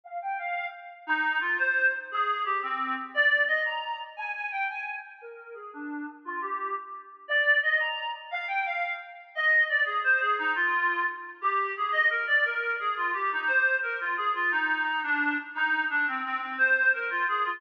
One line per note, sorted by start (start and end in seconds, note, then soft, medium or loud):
0.04 0.18 F5 loud
0.22 0.37 G5 loud
0.38 0.66 F5 medium
1.07 1.38 D#4 loud
1.41 1.57 F4 medium
1.59 1.91 C5 medium
2.11 2.42 G#4 loud
2.45 2.60 G4 medium
2.63 2.95 C4 medium
3.14 3.43 D5 loud
3.48 3.62 D#5 loud
3.65 3.98 A#5 medium
4.17 4.32 G#5 loud
4.35 4.49 G#5 loud
4.52 4.67 G5 loud
4.70 4.98 G#5 medium
5.21 5.54 A#4 loud
5.54 5.70 G#4 medium
5.73 6.05 D4 medium
6.25 6.40 F4 loud
6.41 6.73 G4 medium
7.28 7.58 D5 loud
7.63 7.79 D#5 loud
7.80 8.09 A#5 loud
8.31 8.45 F5 loud
8.48 8.63 G5 loud
8.65 8.93 F5 medium
9.35 9.65 D#5 loud
9.69 9.83 D5 medium
9.85 10.00 G#4 loud
10.04 10.21 C5 loud
10.21 10.36 G#4 loud
10.38 10.53 D#4 loud
10.55 11.04 F4 loud
11.41 11.73 G4 loud
11.77 11.93 G#4 loud
11.92 12.09 D#5 loud
12.10 12.25 A#4 loud
12.27 12.44 D5 loud
12.44 12.75 A#4 loud
12.79 12.95 G#4 medium
12.97 13.11 F4 medium
13.13 13.30 G4 medium
13.32 13.48 D#4 medium
13.47 13.75 C5 loud
13.83 13.99 A#4 medium
14.01 14.15 F4 medium
14.17 14.31 G#4 loud
14.35 14.51 F4 loud
14.51 15.01 D#4 loud
15.03 15.35 D4 loud
15.55 15.84 D#4 loud
15.90 16.06 D4 loud
16.08 16.22 C4 medium
16.24 16.39 C4 loud
16.41 16.56 C4 medium
16.58 16.92 C5 loud
16.93 17.10 A#4 medium
17.11 17.26 F4 loud
17.28 17.44 G#4 loud
17.45 17.61 F4 loud